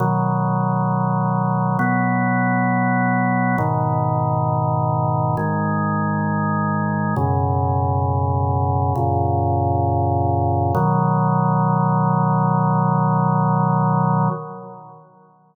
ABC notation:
X:1
M:4/4
L:1/8
Q:1/4=67
K:B
V:1 name="Drawbar Organ"
[B,,D,F,]4 [B,,F,B,]4 | [G,,B,,D,]4 [G,,D,G,]4 | [F,,B,,C,]4 [F,,A,,C,]4 | [B,,D,F,]8 |]